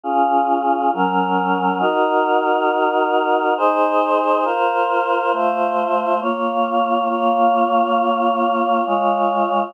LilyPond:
\new Staff { \time 3/4 \key bes \minor \partial 2 \tempo 4 = 68 <des' f' aes'>4 <ges des' bes'>4 | <ees' ges' bes'>2 <ees' aes' c''>4 | <f' bes' c''>4 <a f' c''>4 <bes f' des''>4 | <bes f' des''>2 <aes f' des''>4 | }